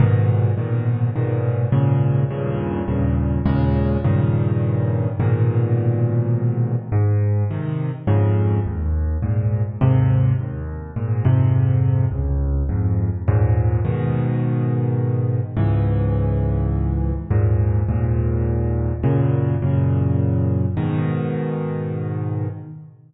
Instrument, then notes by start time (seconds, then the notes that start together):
acoustic grand piano
0.00 G#2 A#2 B2 D#3
0.57 G#2 A#2 B2 D#3
1.16 G#2 A#2 B2 D#3
1.72 D#2 G#2 A#2 C#3
2.31 D#2 G2 A#2 C#3
2.88 D#2 G2 A#2 C#3
3.46 D#2 A#2 C#3 G#3
4.04 G2 A#2 C#3 D#3
5.20 G#2 A#2 B2 D#3
6.92 G#2
7.50 C3 D#3
8.07 F2 G#2 C#3
8.66 D#2
9.22 G#2 A#2
9.81 D#2 G#2 C3
10.40 D#2
10.96 G#2 A#2
11.25 F2 G#2 C3
12.11 C#2
12.69 F2 G#2
13.28 D#2 G#2 A#2
13.85 G#2 B2 D#3
15.57 C#2 G#2 E3
17.31 D#2 G#2 A#2
17.89 D#2 G#2 A#2
19.03 F#2 A#2 C#3
19.62 F#2 A#2 C#3
20.77 G#2 B2 D#3